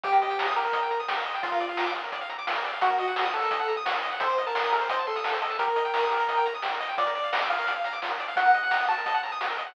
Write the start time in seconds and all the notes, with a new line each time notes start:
0.03 D#2 G4, kick, closed hi-hat
0.13 A#4, kick, closed hi-hat
0.22 D#5, closed hi-hat
0.30 G5, closed hi-hat
0.39 A#5, snare
0.47 D#6, closed hi-hat
0.56 G4 A#4, closed hi-hat
0.65 A#4, closed hi-hat
0.73 D#5, kick, closed hi-hat
0.82 G5, closed hi-hat
0.91 A#5, closed hi-hat
1.00 D#6, closed hi-hat
1.07 C2 G4, snare
1.17 A#4
1.26 B1 D#5, closed hi-hat
1.34 G5, closed hi-hat
1.43 A#1 F4, kick, closed hi-hat
1.52 A#4, kick, closed hi-hat
1.60 D5, closed hi-hat
1.69 F5, closed hi-hat
1.77 A#5, snare
1.86 D6, closed hi-hat
1.95 F4, closed hi-hat
2.04 A#4, closed hi-hat
2.12 D5, kick, closed hi-hat
2.21 F5, closed hi-hat
2.29 A#5, closed hi-hat
2.39 D6, closed hi-hat
2.47 F4, snare
2.56 A#4, closed hi-hat
2.64 D5, closed hi-hat
2.73 F5, closed hi-hat
2.81 D#2 F#4, kick, closed hi-hat
2.90 A#4, kick, closed hi-hat
2.98 D#5, closed hi-hat
3.08 F#5, closed hi-hat
3.16 A#5, snare
3.25 D#6, closed hi-hat
3.34 F#4 A4, closed hi-hat
3.42 A#4, closed hi-hat
3.51 D#5, kick, closed hi-hat
3.59 F#5, closed hi-hat
3.68 A#5, closed hi-hat
3.76 D#6, closed hi-hat
3.85 F#4, snare
3.94 A#4, closed hi-hat
4.03 D#5, closed hi-hat
4.11 F#5, closed hi-hat
4.20 A1 A4 C5, kick, closed hi-hat
4.29 C5, kick, closed hi-hat
4.38 D#5, closed hi-hat
4.46 A#4 A5, closed hi-hat
4.55 C6, snare
4.63 D#6, closed hi-hat
4.72 A4 A#4, closed hi-hat
4.81 C5, closed hi-hat
4.89 C5 D#5, kick, closed hi-hat
4.98 A5, closed hi-hat
5.07 A4 C6, closed hi-hat
5.16 D#6, closed hi-hat
5.24 A4, snare
5.33 C5, closed hi-hat
5.41 A4 D#5, closed hi-hat
5.50 A5, closed hi-hat
5.59 G4 A#4, kick, closed hi-hat
5.67 A#4, kick, closed hi-hat
5.76 D#5, closed hi-hat
5.85 G5, closed hi-hat
5.94 A#5, snare
6.02 D#6, closed hi-hat
6.11 G4, closed hi-hat
6.19 A#4, closed hi-hat
6.28 D#5, kick, closed hi-hat
6.37 G5, closed hi-hat
6.46 A#5, closed hi-hat
6.54 D#6, closed hi-hat
6.63 G4, snare
6.72 A#4, closed hi-hat
6.80 D#5, closed hi-hat
6.89 G5, closed hi-hat
6.97 A#1 F4 D5, kick, closed hi-hat
7.07 A#4, kick, closed hi-hat
7.15 D5, closed hi-hat
7.24 F5, closed hi-hat
7.32 A#5, snare
7.41 D6, closed hi-hat
7.50 F4 F5
7.58 A#4, closed hi-hat
7.67 D5, kick, closed hi-hat
7.76 F5, closed hi-hat
7.84 A#5, closed hi-hat
7.93 D6, closed hi-hat
8.02 F4, snare
8.10 A#4, closed hi-hat
8.19 D5, closed hi-hat
8.28 F5, closed hi-hat
8.36 D#2 F#4 F#5, kick, closed hi-hat
8.45 A#4, kick, closed hi-hat
8.54 D#5, closed hi-hat
8.63 F#5, closed hi-hat
8.71 A#5, snare
8.80 D#6, closed hi-hat
8.88 F#4 A5, closed hi-hat
8.97 A#4, closed hi-hat
9.06 D#5, kick, closed hi-hat
9.14 F#5, closed hi-hat
9.23 A#5, closed hi-hat
9.32 D#6, closed hi-hat
9.41 F#4, snare
9.50 A#4, closed hi-hat
9.58 D#5, closed hi-hat
9.66 F#5, closed hi-hat